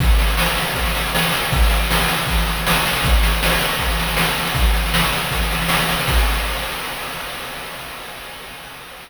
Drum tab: CC |----------------|----------------|----------------|----------------|
SD |oooooooooooooooo|oooooooooooooooo|oooooooooooooooo|oooooooooooooooo|
BD |o-------o-------|o-------o-------|o-------o-------|o-------o-------|

CC |x---------------|
SD |----------------|
BD |o---------------|